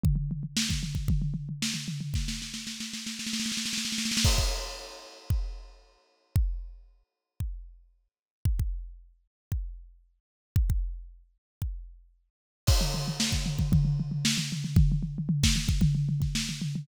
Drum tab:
CC |--------------------------------|--------------------------------|x-------------------------------|--------------------------------|
SD |--------o---------------o-------|o-o-o-o-o-o-o-o-oooooooooooooooo|--------------------------------|--------------------------------|
FT |o-o-o-o---o-o-o-o-o-o-o---o-o-o-|--------------------------------|--------------------------------|--------------------------------|
BD |o---------o---o-o---------------|o-------------------------------|o-o-------------o---------------|o---------------o---------------|

CC |--------------------------------|--------------------------------|x-------------------------------|--------------------------------|
SD |--------------------------------|--------------------------------|--------o---o-----------o-----o-|----------o-o---------o-o-------|
FT |--------------------------------|--------------------------------|--o-o-o---o-o-o-o-o-o-o---o-o-o-|o-o-o-o-o---o-o-o-o-o-o---o-o-o-|
BD |o-o-------------o---------------|o-o-------------o---------------|o---------o---o-o---------------|o---------o---o-o-----o---------|